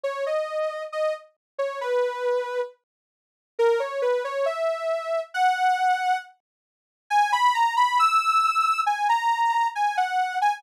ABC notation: X:1
M:2/4
L:1/16
Q:1/4=68
K:Bmix
V:1 name="Ocarina"
c d3 d z2 c | B4 z4 | [K:F#mix] A c B c e4 | f4 z4 |
g b a b e'4 | g a3 g f2 g |]